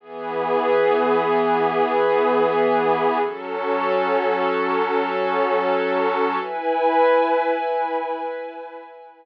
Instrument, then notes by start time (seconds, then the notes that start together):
pad 5 (bowed)
0.00 E3 B3 G#4
3.20 F#3 C#4 A4
6.40 E4 B4 G#5